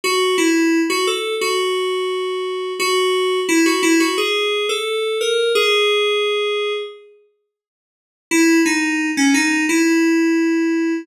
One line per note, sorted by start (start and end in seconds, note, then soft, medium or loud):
0.04 0.36 F#4 loud
0.38 0.80 E4 loud
0.90 1.06 F#4 loud
1.07 1.35 A4 loud
1.41 2.73 F#4 loud
2.79 3.40 F#4 loud
3.49 3.65 E4 loud
3.66 3.82 F#4 loud
3.83 3.99 E4 loud
4.00 4.17 F#4 loud
4.18 4.66 G#4 loud
4.69 5.18 A4 loud
5.21 5.52 A#4 medium
5.55 6.73 G#4 loud
8.31 8.60 E4 loud
8.66 9.09 D#4 loud
9.17 9.33 C#4 loud
9.34 9.64 D#4 loud
9.69 11.02 E4 loud